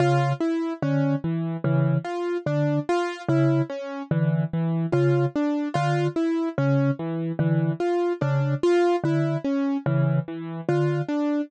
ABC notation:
X:1
M:7/8
L:1/8
Q:1/4=73
K:none
V:1 name="Vibraphone" clef=bass
^C, z D, z C, z D, | z ^C, z D, z C, z | D, z ^C, z D, z C, | z D, z ^C, z D, z |]
V:2 name="Acoustic Grand Piano"
F E ^C E, E, F D | F E ^C E, E, F D | F E ^C E, E, F D | F E ^C E, E, F D |]